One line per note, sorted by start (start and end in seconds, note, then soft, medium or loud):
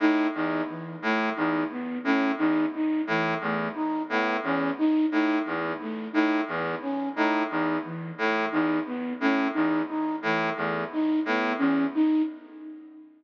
0.00 0.27 A2 medium
0.00 0.28 D#4 medium
0.35 0.62 E2 medium
0.35 0.62 D#4 medium
0.69 0.96 E3 medium
1.02 1.30 A2 medium
1.02 1.30 A3 medium
1.36 1.64 E2 medium
1.36 1.64 D#4 medium
1.71 1.98 B3 medium
2.04 2.32 A2 medium
2.04 2.31 C#4 medium
2.38 2.65 E2 medium
2.38 2.65 D#4 medium
2.74 3.01 D#4 medium
3.07 3.34 A2 medium
3.07 3.35 E3 medium
3.41 3.68 E2 medium
3.41 3.69 A3 medium
3.75 4.02 D#4 medium
4.09 4.37 A2 medium
4.09 4.37 B3 medium
4.43 4.71 E2 medium
4.43 4.71 C#4 medium
4.78 5.06 D#4 medium
5.11 5.39 A2 medium
5.11 5.38 D#4 medium
5.45 5.73 E2 medium
5.45 5.72 E3 medium
5.81 6.08 A3 medium
6.13 6.41 A2 medium
6.13 6.40 D#4 medium
6.48 6.75 E2 medium
6.48 6.76 B3 medium
6.82 7.09 C#4 medium
7.15 7.43 A2 medium
7.15 7.43 D#4 medium
7.50 7.78 E2 medium
7.50 7.77 D#4 medium
7.84 8.11 E3 medium
8.18 8.45 A2 medium
8.18 8.45 A3 medium
8.52 8.79 E2 medium
8.52 8.79 D#4 medium
8.86 9.13 B3 medium
9.20 9.48 A2 medium
9.20 9.47 C#4 medium
9.54 9.82 E2 medium
9.54 9.81 D#4 medium
9.88 10.16 D#4 medium
10.22 10.50 A2 medium
10.22 10.50 E3 medium
10.57 10.84 E2 medium
10.57 10.84 A3 medium
10.92 11.20 D#4 medium
11.25 11.53 A2 medium
11.25 11.54 B3 medium
11.58 11.86 E2 medium
11.58 11.85 C#4 medium
11.95 12.22 D#4 medium